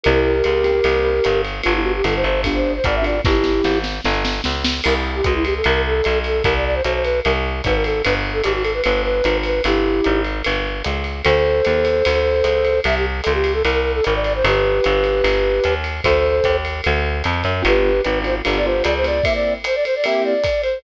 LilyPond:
<<
  \new Staff \with { instrumentName = "Flute" } { \time 4/4 \key g \major \tempo 4 = 150 <g' bes'>1 | f'16 e'16 fis'16 g'16 a'16 c''16 c''8 r16 c''8 c''16 d''16 e''16 d''8 | <e' g'>4. r2 r8 | bes'16 r8 g'16 fis'16 e'16 g'16 a'16 bes'8 a'4 a'8 |
bes'16 d''16 d''16 c''16 c''16 c''16 ces''8 bes'16 r8. ces''16 bes'16 a'8 | b'16 r8 a'16 g'16 fis'16 a'16 b'16 b'8 b'4 b'8 | <e' g'>4. r2 r8 | <a' c''>1 |
e''16 g'16 r8 a'16 g'8 a'16 bes'8. a'16 bes'16 d''16 d''16 c''16 | <g' b'>1 | <a' c''>4. r2 r8 | <g' b'>4 b'8 c''16 r8 d''16 c''8 d''16 c''16 d''8 |
e''16 d''8 r16 c''16 d''16 c''16 d''16 e''8 d''4 c''8 | }
  \new Staff \with { instrumentName = "Acoustic Grand Piano" } { \time 4/4 \key g \major <bes c' e' g'>4. <bes c' e' g'>8 <bes c' e' g'>2 | <b d' f' g'>2 <b d' f' g'>4. <b d' f' g'>8 | r1 | r1 |
r1 | r1 | r1 | r1 |
r1 | r1 | r1 | <b d' f' g'>4. <b d' f' g'>8 <b d' f' g'>8 <b d' f' g'>4 <b d' f' g'>8 |
<bes c' e' g'>2 <bes c' e' g'>2 | }
  \new Staff \with { instrumentName = "Electric Bass (finger)" } { \clef bass \time 4/4 \key g \major c,4 cis,4 c,4 g,,4 | g,,4 g,,8 g,,4. gis,,4 | g,,4 gis,,4 g,,4 cis,4 | c,4 cis,4 c,4 b,,4 |
c,4 b,,4 c,4 gis,,4 | g,,4 gis,,4 g,,4 gis,,4 | g,,4 gis,,4 g,,4 cis,4 | d,4 dis,4 d,4 cis,4 |
c,4 cis,4 c,4 gis,,4 | g,,4 g,,4 g,,4 dis,4 | d,4 dis,4 d,4 f,8 fis,8 | g,,4 gis,,4 g,,4 cis,4 |
r1 | }
  \new DrumStaff \with { instrumentName = "Drums" } \drummode { \time 4/4 cymr4 <hhp cymr>8 cymr8 cymr4 <hhp cymr>8 cymr8 | cymr4 <hhp cymr>8 cymr8 <bd cymr>4 <hhp bd cymr>8 cymr8 | <bd sn>8 sn8 sn8 sn8 sn8 sn8 sn8 sn8 | <cymc cymr>4 <hhp bd cymr>8 cymr8 cymr4 <hhp cymr>8 cymr8 |
<bd cymr>4 <hhp cymr>8 cymr8 cymr4 <hhp bd cymr>8 cymr8 | cymr4 <hhp cymr>8 cymr8 cymr4 <hhp cymr>8 cymr8 | cymr4 <hhp cymr>8 cymr8 cymr4 <hhp cymr>8 cymr8 | cymr4 <hhp cymr>8 cymr8 cymr4 <hhp cymr>8 cymr8 |
cymr4 <hhp cymr>8 cymr8 cymr4 <hhp cymr>8 cymr8 | cymr4 <hhp cymr>8 cymr8 cymr4 <hhp cymr>8 cymr8 | <bd cymr>4 <hhp bd cymr>8 cymr8 cymr4 <hhp cymr>8 cymr8 | cymr4 <hhp cymr>8 cymr8 cymr4 <hhp cymr>8 cymr8 |
<bd cymr>4 <hhp cymr>8 cymr8 cymr4 <hhp bd cymr>8 cymr8 | }
>>